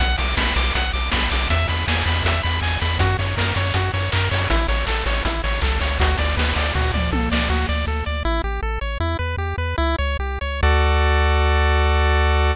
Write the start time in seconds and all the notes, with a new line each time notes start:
0.00 B1 F#5, kick, closed hi-hat
0.18 B1 D6, open hi-hat
0.37 B1 B5, kick, snare
0.56 B1 D6, open hi-hat
0.75 B1 F#5, kick, closed hi-hat
0.93 B1 D6, open hi-hat
1.12 B1 B5, kick, snare
1.31 B1 D6, open hi-hat
1.49 E2 E5, kick, closed hi-hat
1.68 E2 B5, open hi-hat
1.88 E2 G#5, kick, snare
2.06 E2 B5, open hi-hat
2.23 E2 E5, kick, closed hi-hat
2.43 E2 B5, open hi-hat
2.61 E2 G#5, kick, clap
2.81 E2 B5, open hi-hat
2.99 F#2 F#4, kick, closed hi-hat
3.19 F#2 C#5, open hi-hat
3.37 F#2 A#4, kick, snare
3.56 F#2 C#5, open hi-hat
3.74 F#2 F#4, kick, closed hi-hat
3.94 F#2 C#5, open hi-hat
4.12 F#2 A#4, kick, clap
4.31 F#2 C#5, open hi-hat
4.50 A1 E4, kick, closed hi-hat
4.68 A1 C#5, open hi-hat
4.87 A1 A4, kick, clap
5.06 A1 C#5, open hi-hat
5.25 A1 E4, kick, closed hi-hat
5.44 A1 C#5, open hi-hat
5.62 C2 A4, kick, clap
5.81 C#2 C#5, open hi-hat
6.00 D2 F#4, kick, closed hi-hat
6.18 D2 D5, open hi-hat
6.36 D2 B4, kick, snare
6.56 D2 D5, open hi-hat
6.74 D2 F#4, kick, floor tom
6.94 D2 D5, mid tom
7.12 C2 A4, high tom
7.32 C#2 D5, snare
7.50 D2 F#4
7.69 D2 D5
7.87 D2 A4
8.06 D2 D5
8.25 A1 E4
8.44 A1 G4
8.62 A1 A4
8.81 A1 C#5
9.00 E2 E4
9.19 E2 B4
9.37 E2 G4
9.58 E2 B4
9.78 C#2 E4
9.98 C#2 C#5
10.19 C2 G4
10.41 C#2 C#5
10.63 D2 F#4 A4 D5